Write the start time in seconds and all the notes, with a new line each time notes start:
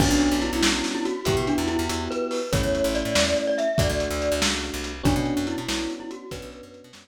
0.00 B1 B3 C#4 D4 F#4, kick, crash
0.11 B1
0.20 closed hi-hat
0.32 B1
0.42 E4, closed hi-hat
0.53 B1
0.63 B1, snare
0.84 snare
0.95 E4
1.05 F#4, closed hi-hat
1.25 E2 B3 E4 F#4 G4, kick, closed hi-hat
1.37 B2
1.47 D4, closed hi-hat
1.58 E2 E4
1.68 E4, closed hi-hat
1.79 E2
1.89 E2, closed hi-hat
2.11 B4, closed hi-hat
2.31 open hi-hat
2.52 A1 A3 C#4 E4 C#5, kick, closed hi-hat
2.63 E2
2.75 closed hi-hat
2.84 A1
2.95 D5, closed hi-hat
3.05 A2
3.15 E2, snare
3.37 closed hi-hat
3.47 D5
3.58 E5, closed hi-hat
3.78 D2 A3 D4 F#4 D5, kick, closed hi-hat
3.89 D2
4.00 closed hi-hat
4.11 D2
4.22 closed hi-hat
4.32 D2
4.42 C#2, snare
4.64 closed hi-hat
4.74 C2
4.84 closed hi-hat
5.03 B1 B3 C#4 D4 F#4, kick, closed hi-hat
5.16 B2
5.26 closed hi-hat
5.37 F#2
5.47 E4, closed hi-hat
5.58 B2
5.68 B1 B3 C#4 D4 F#4, snare
5.90 closed hi-hat
6.00 E4
6.11 F#4, closed hi-hat
6.31 B1 B3 C#4 D4 F#4 B4, kick, closed hi-hat
6.42 B1
6.52 closed hi-hat
6.63 F#2
6.74 closed hi-hat
6.84 B2
6.93 F#2 B3 C#4 D4 F#4, snare